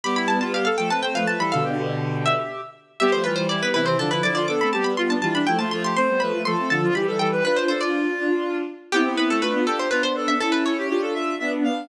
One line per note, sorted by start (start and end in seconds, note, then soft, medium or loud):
0.04 0.67 G3 medium
0.04 0.67 B3 medium
0.04 0.16 G4 medium
0.04 0.16 B5 medium
0.16 0.27 E4 medium
0.16 0.28 B5 medium
0.28 0.39 E4 medium
0.28 0.40 A5 medium
0.41 0.52 F4 medium
0.41 0.53 A5 medium
0.53 0.65 G4 medium
0.53 0.64 F5 medium
0.65 0.77 A4 medium
0.65 0.77 F5 medium
0.77 0.90 F3 medium
0.77 0.90 A3 medium
0.77 0.89 A4 medium
0.77 0.89 G5 medium
0.90 1.02 A3 medium
0.90 1.02 C4 medium
0.90 1.02 B4 medium
0.90 1.02 A5 medium
1.02 1.13 A3 soft
1.02 1.14 C4 medium
1.02 1.14 C5 medium
1.02 1.14 G5 medium
1.14 1.26 F3 medium
1.14 1.26 A3 medium
1.14 1.27 B4 medium
1.14 1.27 F5 medium
1.27 1.39 F3 soft
1.27 1.39 A3 medium
1.27 1.39 B4 medium
1.27 1.39 A5 medium
1.38 1.50 E3 medium
1.38 1.50 G3 medium
1.38 1.51 A4 medium
1.38 1.52 B5 medium
1.51 2.34 B2 medium
1.51 2.34 D3 medium
1.51 1.63 A4 medium
1.51 2.19 F5 medium
1.64 2.61 G4 medium
2.26 2.70 E5 medium
3.00 3.12 G3 medium
3.00 3.12 B3 medium
3.00 3.22 G4 medium
3.00 3.12 E5 medium
3.12 3.25 F3 medium
3.12 3.25 A3 medium
3.12 3.24 C5 medium
3.24 3.36 E3 medium
3.24 3.36 G3 medium
3.24 3.45 F4 medium
3.24 3.35 B4 medium
3.36 3.48 E3 medium
3.36 3.48 G3 medium
3.36 3.47 C5 medium
3.49 3.62 E3 medium
3.49 3.61 G3 medium
3.49 3.69 E4 medium
3.49 3.61 D5 medium
3.62 3.73 G3 medium
3.62 3.73 B3 medium
3.62 3.73 B4 medium
3.74 3.95 C3 medium
3.74 3.95 E3 medium
3.74 3.85 E4 medium
3.74 3.86 B4 medium
3.86 3.98 C4 medium
3.86 3.97 C5 medium
3.99 4.09 D3 medium
3.99 4.09 F3 medium
3.99 4.11 D4 medium
3.99 4.11 A4 medium
4.10 4.22 D3 medium
4.10 4.22 F3 medium
4.10 4.23 E4 medium
4.10 4.23 B4 medium
4.22 4.46 D3 medium
4.22 4.46 F3 medium
4.22 4.35 E4 medium
4.22 4.34 D5 medium
4.35 4.47 F4 medium
4.35 4.47 D5 medium
4.48 4.60 B3 medium
4.48 4.60 D4 medium
4.48 4.71 A4 medium
4.48 4.60 D6 medium
4.61 4.73 A3 medium
4.61 4.73 C4 medium
4.61 4.73 B5 medium
4.73 4.83 G3 medium
4.73 4.83 B3 medium
4.73 4.93 G4 medium
4.73 4.85 A5 medium
4.84 4.95 G3 medium
4.84 4.95 B3 medium
4.84 4.96 B5 medium
4.97 5.10 G3 medium
4.97 5.08 B3 medium
4.97 5.17 F4 medium
4.97 5.09 C6 medium
5.09 5.20 B3 medium
5.09 5.20 D4 medium
5.09 5.22 A5 medium
5.21 5.42 E3 medium
5.21 5.42 G3 medium
5.21 5.34 F4 medium
5.21 5.34 A5 medium
5.34 5.46 D4 medium
5.34 5.47 B5 medium
5.47 5.58 F3 medium
5.47 5.58 A3 medium
5.47 5.59 E4 medium
5.47 5.58 G5 medium
5.59 5.71 F3 medium
5.59 5.71 A3 medium
5.59 5.70 F4 medium
5.59 5.70 A5 medium
5.71 5.93 F3 medium
5.71 5.93 A3 medium
5.71 5.83 F4 medium
5.71 5.83 C6 medium
5.84 5.96 G4 medium
5.84 5.96 C6 medium
5.96 6.08 A3 medium
5.96 6.08 C4 medium
5.96 6.20 C5 medium
5.96 6.20 C6 medium
6.08 6.20 G3 medium
6.08 6.20 B3 medium
6.20 6.32 F3 medium
6.20 6.32 A3 medium
6.20 6.42 B4 medium
6.20 6.41 B5 medium
6.32 6.44 F3 medium
6.32 6.44 A3 medium
6.44 6.56 F3 medium
6.44 6.56 A3 medium
6.44 6.69 A4 medium
6.44 6.67 C6 medium
6.58 6.70 A3 medium
6.58 6.70 C4 medium
6.70 6.90 D3 medium
6.70 6.90 F3 medium
6.70 6.81 A4 medium
6.70 6.94 A5 medium
6.82 6.94 F4 medium
6.94 7.06 E3 medium
6.94 7.06 G3 medium
6.94 7.06 G4 medium
6.94 7.16 B5 medium
7.07 7.19 E3 medium
7.07 7.19 G3 medium
7.07 7.19 A4 medium
7.19 7.41 E3 medium
7.19 7.41 G3 medium
7.19 7.31 A4 medium
7.19 7.42 G5 medium
7.32 7.44 B4 medium
7.44 8.09 D4 medium
7.44 8.09 F4 medium
7.44 7.64 B4 medium
7.44 7.56 B4 medium
7.56 7.68 C5 medium
7.68 7.81 A4 medium
7.68 7.80 C5 medium
7.81 8.57 F4 medium
7.81 8.40 D5 medium
8.18 8.63 D4 medium
8.18 8.63 F4 medium
8.92 9.05 B3 medium
8.92 9.38 C4 medium
8.92 9.38 E4 medium
8.92 9.14 G4 medium
9.05 9.17 B3 medium
9.17 9.29 B3 medium
9.17 9.29 B4 medium
9.30 9.42 A3 medium
9.30 9.42 A4 medium
9.42 9.54 A3 medium
9.42 9.85 D4 medium
9.42 9.85 F4 medium
9.42 9.64 B4 medium
9.54 9.66 B3 medium
9.66 9.87 G4 medium
9.66 9.79 A4 medium
9.79 9.91 C5 medium
9.91 10.34 B3 medium
9.91 10.34 D4 medium
9.91 10.03 F4 medium
9.91 10.02 B4 medium
10.03 10.15 C5 medium
10.16 10.39 A4 medium
10.28 10.40 E5 medium
10.40 10.83 C#4 medium
10.40 10.83 E4 medium
10.40 10.52 A4 medium
10.52 10.64 A4 medium
10.52 10.64 B4 medium
10.65 10.77 A4 medium
10.65 11.49 C#5 medium
10.78 10.89 G4 medium
10.89 11.34 D4 medium
10.89 11.34 F4 medium
10.89 11.01 G4 medium
11.02 11.13 A4 medium
11.14 11.35 E5 medium
11.39 11.87 B3 medium
11.39 11.87 D4 medium
11.39 11.51 E5 medium
11.64 11.87 F5 medium